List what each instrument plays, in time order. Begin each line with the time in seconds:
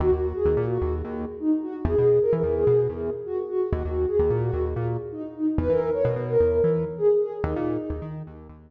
0.00 synth bass 1 D#2, ocarina F#4
0.12 synth bass 1 D#2, ocarina F#4
0.35 ocarina G#4
0.45 synth bass 1 D#2
0.57 synth bass 1 A#2
0.70 ocarina F#4
0.81 synth bass 1 D#2
1.04 synth bass 1 D#2
1.40 ocarina D#4
1.63 ocarina F#4
1.85 synth bass 1 E2, ocarina G#4
1.98 synth bass 1 B2, ocarina G#4
2.21 ocarina A#4
2.33 synth bass 1 E3
2.43 synth bass 1 E2
2.56 ocarina G#4
2.67 synth bass 1 B2
2.89 synth bass 1 E2
3.26 ocarina F#4
3.49 ocarina F#4
3.72 synth bass 1 D#2, ocarina F#4
3.84 synth bass 1 D#2, ocarina F#4
4.07 ocarina G#4
4.19 synth bass 1 D#2
4.30 synth bass 1 A#2
4.42 ocarina F#4
4.53 synth bass 1 D#2
4.76 synth bass 1 A#2
5.12 ocarina D#4
5.35 ocarina D#4
5.58 synth bass 1 E2, ocarina B4
5.69 synth bass 1 E3, ocarina A#4
5.93 ocarina C#5
6.05 synth bass 1 B2
6.16 synth bass 1 B2
6.28 ocarina A#4
6.40 synth bass 1 E2
6.64 synth bass 1 E3
6.98 ocarina G#4
7.21 ocarina G#4
7.44 synth bass 1 D#2, ocarina D#4
7.56 synth bass 1 A#2
7.90 synth bass 1 D#2
8.02 synth bass 1 D#3
8.27 synth bass 1 D#2
8.49 synth bass 1 D#2